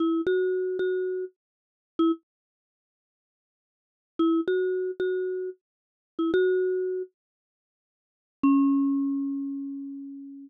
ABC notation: X:1
M:4/4
L:1/16
Q:1/4=114
K:C#m
V:1 name="Marimba"
E2 F4 F4 z5 E | z16 | E2 F4 F4 z5 E | F6 z10 |
C16 |]